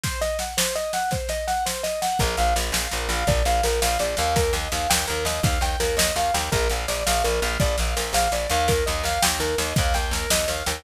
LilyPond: <<
  \new Staff \with { instrumentName = "Acoustic Grand Piano" } { \time 6/8 \key bes \mixolydian \tempo 4. = 111 c''8 ees''8 ges''8 c''8 ees''8 ges''8 | c''8 ees''8 ges''8 c''8 ees''8 ges''8 | bes'8 f''8 d''8 f''8 bes'8 f''8 | d''8 f''8 bes'8 f''8 d''8 f''8 |
bes'8 ees''8 f''8 g''8 bes'8 ees''8 | f''8 g''8 bes'8 ees''8 f''8 g''8 | bes'8 f''8 d''8 f''8 bes'8 f''8 | d''8 f''8 bes'8 f''8 d''8 f''8 |
bes'8 ees''8 f''8 g''8 bes'8 ees''8 | f''8 g''8 bes'8 ees''8 f''8 g''8 | }
  \new Staff \with { instrumentName = "Electric Bass (finger)" } { \clef bass \time 6/8 \key bes \mixolydian r2. | r2. | bes,,8 bes,,8 bes,,8 bes,,8 bes,,8 bes,,8 | bes,,8 bes,,8 bes,,8 bes,,8 bes,,8 ees,8~ |
ees,8 ees,8 ees,8 ees,8 ees,8 ees,8 | ees,8 ees,8 ees,8 ees,8 ees,8 ees,8 | bes,,8 bes,,8 bes,,8 bes,,8 bes,,8 bes,,8 | bes,,8 bes,,8 bes,,8 bes,,8 bes,,8 ees,8~ |
ees,8 ees,8 ees,8 ees,8 ees,8 ees,8 | ees,8 ees,8 ees,8 ees,8 ees,8 ees,8 | }
  \new DrumStaff \with { instrumentName = "Drums" } \drummode { \time 6/8 <bd sn>8 sn8 sn8 sn8 sn8 sn8 | <bd sn>8 sn8 sn8 sn8 sn8 sn8 | <bd sn>8 sn8 sn8 sn8 sn8 sn8 | <bd sn>8 sn8 sn8 sn8 sn8 sn8 |
<bd sn>8 sn8 sn8 sn8 sn8 sn8 | <bd sn>8 sn8 sn8 sn8 sn8 sn8 | <bd sn>8 sn8 sn8 sn8 sn8 sn8 | <bd sn>8 sn8 sn8 sn8 sn8 sn8 |
<bd sn>8 sn8 sn8 sn8 sn8 sn8 | <bd sn>8 sn8 sn8 sn8 sn8 sn8 | }
>>